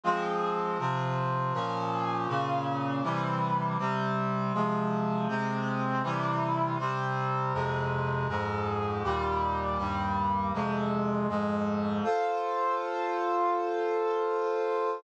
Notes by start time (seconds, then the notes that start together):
0.03 F3 G#3 C4
0.79 C3 F3 C4
1.53 A#2 F3 C#4
2.28 A#2 C#3 C#4
3.03 C3 E3 G3
3.78 C3 G3 C4
4.54 C3 F3 G#3
5.28 C3 G#3 C4
6.03 C3 E3 G3
6.79 C3 G3 C4
7.53 F2 C3 G#3
8.28 F2 G#2 G#3
9.04 D#2 A#2 G3
9.78 D#2 G2 G3
10.53 F2 C3 G#3
11.29 F2 G#2 G#3
12.03 F4 A4 C5